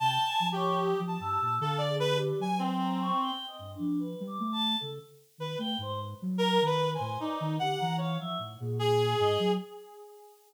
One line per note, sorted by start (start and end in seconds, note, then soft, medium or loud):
0.00 0.18 C3 medium
0.00 0.24 G5 medium
0.00 0.47 A5 loud
0.26 0.50 G#5 loud
0.40 0.94 F3 medium
0.52 1.00 G4 medium
0.52 0.79 C#5 loud
0.80 1.16 D#6 medium
1.00 1.18 F3 loud
1.07 1.55 A5 medium
1.20 1.38 G2 medium
1.20 1.57 E6 loud
1.41 1.59 A#2 medium
1.60 2.32 D3 loud
1.60 1.79 A4 medium
1.60 1.85 F5 medium
1.78 1.96 D5 medium
1.88 2.12 G#4 medium
2.00 2.18 B4 loud
2.15 2.39 G4 medium
2.39 3.11 F#3 medium
2.39 2.59 G#5 medium
2.59 3.31 C4 medium
2.81 2.99 A#5 medium
3.01 3.19 C#6 loud
3.21 3.45 G5 medium
3.47 3.71 D#5 soft
3.59 3.77 G2 medium
3.75 3.99 D4 medium
3.79 4.15 F3 medium
4.00 4.24 B4 medium
4.20 4.38 G3 loud
4.27 4.51 D6 medium
4.40 4.75 A3 loud
4.52 4.76 A5 loud
4.80 4.99 C#3 medium
4.80 4.98 A4 medium
5.38 5.56 D#3 medium
5.38 5.58 B4 medium
5.58 5.76 A3 medium
5.58 5.77 G5 medium
5.78 6.14 G#2 medium
5.78 6.00 C5 loud
6.22 6.58 F#3 loud
6.38 6.62 A#4 loud
6.38 6.65 A#5 loud
6.61 6.97 D#3 medium
6.66 6.90 B4 medium
6.66 6.91 B5 loud
6.95 7.19 C5 medium
6.95 7.19 G#5 medium
7.00 7.18 A2 loud
7.20 7.56 D#4 medium
7.20 7.38 D5 medium
7.40 7.58 D#3 loud
7.59 7.77 D3 medium
7.59 7.78 G4 medium
7.59 7.95 F#5 loud
7.79 8.17 E3 medium
7.79 7.97 A#5 medium
7.98 8.16 C#5 medium
7.98 8.18 F5 soft
8.20 8.38 F3 medium
8.20 8.38 E5 medium
8.39 8.57 A2 medium
8.60 9.14 A#2 loud
8.60 8.78 G#4 medium
8.79 9.51 G#4 loud
9.19 9.37 G#2 loud
9.19 9.38 D#5 loud
9.39 9.57 F#3 loud